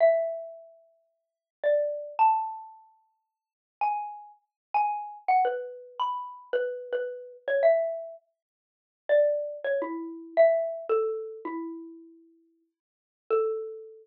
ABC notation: X:1
M:4/4
L:1/8
Q:"Swing" 1/4=110
K:A
V:1 name="Xylophone"
e6 d2 | a6 g2 | z g2 f B2 b2 | B B2 c e2 z2 |
z d2 c E2 e2 | "^rit." A2 E4 z2 | A8 |]